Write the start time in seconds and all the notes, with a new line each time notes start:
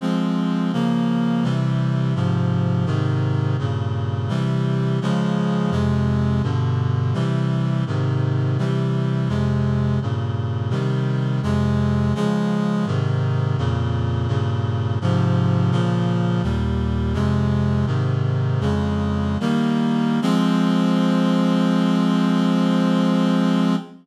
0.01 F3 G#3 C4
0.73 C#3 F3 A#3
1.43 C3 E3 G3
2.15 G#2 C3 F3
2.86 G#2 C3 D#3
3.59 G2 A#2 C#3
4.29 C3 E3 G3
5.01 C#3 F3 G#3
5.71 F2 C3 G#3
6.43 G2 B2 D3
7.14 C3 E3 G3
7.87 G#2 C3 D#3
8.58 C3 E3 G3
9.29 F2 C3 G#3
10.02 G2 A#2 C#3
10.70 C3 D#3 G3
11.43 F2 C3 G#3
12.15 C#3 F3 G#3
12.86 G#2 C3 D#3
13.58 F2 A#2 C#3
14.28 G2 A#2 C#3
15.01 G#2 C3 F3
15.71 A#2 C#3 F3
16.43 D#2 A#2 G3
17.14 F2 C3 G#3
17.87 G#2 C3 D#3
18.61 F2 C#3 G#3
19.40 D#3 G3 A#3
20.22 F3 G#3 C4